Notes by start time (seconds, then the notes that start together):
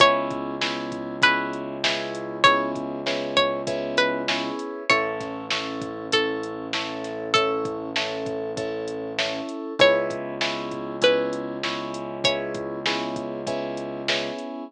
0.00 C#2 B3 C#4 E4 G#4 C#5, kick, closed hi-hat
0.30 kick, closed hi-hat
0.61 B3 C#4 E4 G#4, snare
0.92 kick, closed hi-hat
1.22 B3 C#4 E4 G#4 B4, kick, closed hi-hat
1.53 closed hi-hat
1.84 B3 C#4 E4 G#4, snare
2.15 closed hi-hat
2.44 B3 C#4 E4 G#4 C#5, kick, closed hi-hat
2.75 kick, closed hi-hat
3.06 B3 C#4 E4 G#4, snare
3.37 C#5, kick, closed hi-hat
3.67 B3 C#4 E4 G#4, kick, closed hi-hat
3.97 B4, closed hi-hat
4.28 B3 C#4 E4 G#4, snare
4.59 closed hi-hat
4.90 A1 C#4 E4 A4 C#5, kick, closed hi-hat
5.20 kick, snare, closed hi-hat
5.51 C#4 E4 A4, snare
5.82 kick, closed hi-hat
6.12 C#4 E4 A4, kick, closed hi-hat
6.43 closed hi-hat
6.73 C#4 E4 A4, snare
7.04 snare, closed hi-hat
7.34 C#4 E4 A4, kick, closed hi-hat
7.65 kick, closed hi-hat
7.96 C#4 E4 A4, snare
8.26 kick, closed hi-hat
8.57 C#4 E4 A4, kick, closed hi-hat
8.88 closed hi-hat
9.18 C#4 E4 A4, snare
9.49 closed hi-hat
9.79 C#2 B3 C#4 E4 G#4 C#5, kick, closed hi-hat
10.10 kick, closed hi-hat
10.41 B3 C#4 E4 G#4, snare
10.71 kick, closed hi-hat
11.02 B3 C#4 E4 G#4 B4, kick, closed hi-hat
11.33 closed hi-hat
11.63 B3 C#4 E4 G#4, snare
11.94 closed hi-hat
12.24 B3 C#4 E4 G#4 C#5, kick, closed hi-hat
12.54 kick, closed hi-hat
12.86 B3 C#4 E4 G#4, snare
13.16 kick, closed hi-hat
13.47 B3 C#4 E4 G#4, kick, closed hi-hat
13.77 closed hi-hat
14.08 B3 C#4 E4 G#4, snare
14.39 closed hi-hat